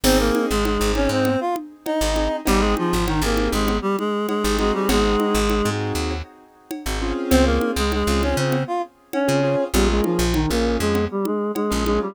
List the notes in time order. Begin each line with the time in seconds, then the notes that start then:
0.04 G#1 C4 D#4 G#4 C5, crash, cowbell, low conga
0.19 A#3 A#4
0.35 high conga
0.50 G#1 G#3 G#4
0.65 G#3 G#4, cowbell, high conga
0.80 G#1 C4 D#4 G#4
0.95 C#4 C#5, high conga
1.09 G#2 C4 C5
1.25 cowbell, low conga
1.41 F4 F5
1.56 high conga
1.86 D#4 D#5, cowbell, high conga
2.01 G#1 C4 D#4 G#4
2.16 C4 D#4 G#4, high conga
2.45 G#1 G3 C4 D#4 G4 G#4, cowbell, low conga
2.60 G#3 G#4
2.77 F3 F4, high conga
2.93 G#1
3.07 D#3 D#4, cowbell, high conga
3.22 G#1 A#3 C4 D#4 G4 G#4 A#4
3.37 high conga
3.53 G#1 G#3 G#4
3.68 cowbell, low conga
3.82 G3 G4
3.99 G#3 G#4, high conga
4.28 G#3 G#4, cowbell, high conga
4.44 G#1 C4 D#4 G4 G#4
4.59 G#3 C4 D#4 F#4 G#4, high conga
4.74 G3 G4
4.89 G#1 G#3 G#4, cowbell, low conga
5.20 high conga
5.35 G#1
5.50 cowbell, high conga
5.65 G#2 C4 D#4 F#4 G#4
5.95 D#2
6.10 cowbell
6.71 cowbell, high conga
6.86 G#1 C4 D#4 F#4 G#4
7.02 C4 C#4 F4 G#4
7.30 C#2 C4 C5, cowbell, low conga
7.45 A#3 A#4
7.61 high conga
7.76 C#2 G#3 G#4
7.92 G#3 G#4, cowbell, high conga
8.07 C#2 C4 C#4 F4 G#4
8.22 C#4 C#5, high conga
8.37 C#3 C4 C5
8.52 cowbell, low conga
8.67 F4 F5
9.13 C#4 C#5, cowbell, high conga
9.28 C#3 C4 C#4 F4 G#4
9.43 C4 C#4 F4 G#4
9.73 A#1 G3 A#3 C#4 F4 G4 G#4, cowbell, low conga
9.90 G#3 G#4
10.04 F3 F4, high conga
10.19 A#1
10.34 D#3 D#4, cowbell, high conga
10.50 A#1 A#3 C#4 F4 G#4 A#4
10.80 F2 G#3 G#4
10.95 cowbell, low conga
11.11 G3 G4
11.25 G#3 G#4, high conga
11.55 G#3 G#4, cowbell, high conga
11.71 A#1 A#3 C#4 F4 G#4
11.86 G#3 A#3 C#4 F4 G#4, high conga
12.02 G3 G4